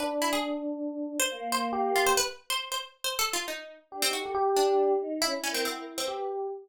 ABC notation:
X:1
M:5/4
L:1/16
Q:1/4=138
K:none
V:1 name="Pizzicato Strings"
B z E ^G2 z6 c3 c2 z2 F c | B z2 c2 c z2 (3c2 A2 F2 ^D3 z2 C ^F2 | z2 D6 E z ^C =C C3 C2 z3 |]
V:2 name="Electric Piano 1"
D12 z4 G4 | z16 G3 G | G6 z2 E8 G4 |]
V:3 name="Choir Aahs"
z12 ^A,8 | z16 (3D2 ^D2 A2 | z2 D4 ^D2 (3^C2 =D2 ^A2 ^F A z B3 z2 |]